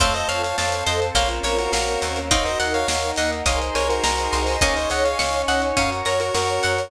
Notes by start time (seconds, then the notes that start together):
0.00 F2 A3 C4 F4 A4 C5 C#5 F5 A5, kick, closed hi-hat
0.14 C5 D#5, closed hi-hat
0.29 F2 C#5 F5, closed hi-hat
0.43 C#5 F5, closed hi-hat
0.58 F2 C4 A4 C5 C#5 F5 A5, snare
0.72 closed hi-hat
0.86 F2 C5 D#5, closed hi-hat
1.02 closed hi-hat
1.14 A#1 A#3 C4 C#4 F4 A#4 C5 C#5 F5 A#5, kick, closed hi-hat
1.29 closed hi-hat
1.43 A#1 A#4 C#5, closed hi-hat
1.59 F#4 A#4, closed hi-hat
1.72 A#1 A#3 C4 C#4 F#4 A#4 F5, snare
1.88 closed hi-hat
2.02 D#2 A#5, closed hi-hat
2.16 closed hi-hat
2.31 C4 D#4 F#4 A#4 C#5 D#5 F5 F#5 A#5, kick, closed hi-hat
2.45 C5 D#5, closed hi-hat
2.60 D#2 D#5 F#5, closed hi-hat
2.74 C#5 F5, closed hi-hat
2.88 D#2 A#3 D#4 A#4 C#5 F5 A#5, snare
3.03 closed hi-hat
3.16 D#2 D#5 F#5, closed hi-hat
3.32 closed hi-hat
3.46 C2 D#4 G#4 A#4 C5 C#5 D#5 F5 G#5 A#5 C6, kick, closed hi-hat
3.62 closed hi-hat
3.75 C2 A#4 C#5 G#5, closed hi-hat
3.89 F#4 A#4, closed hi-hat
4.03 C2 D#4 F#4 G#4 A#4 C5 D#5 A#5, snare
4.18 closed hi-hat
4.33 C2 C6, closed hi-hat
4.47 open hi-hat
4.61 C#2 A#3 C#4 D#4 G#4 C#5 D#5 F5 G#5 C#6, kick, closed hi-hat
4.76 C5 D#5, closed hi-hat
4.90 C#2 D#5 F#5 G#5, closed hi-hat
5.05 C#5 F5, closed hi-hat
5.18 C#2 C#4 D#4 C#5 F5 C#6, snare
5.33 closed hi-hat
5.48 C#2 D#5 F#5, closed hi-hat
5.62 closed hi-hat
5.77 F#2 C#4 F#4 A#4 C#5 F5 F#5 A#5 C#6, kick, closed hi-hat
5.92 closed hi-hat
6.05 F#2 A#4 C#5 A#5, closed hi-hat
6.20 F#4 A#4, closed hi-hat
6.34 F#2 C#4 F#4 A#4 C#5 C#6, snare
6.48 closed hi-hat
6.63 F#2 F#5, closed hi-hat
6.78 closed hi-hat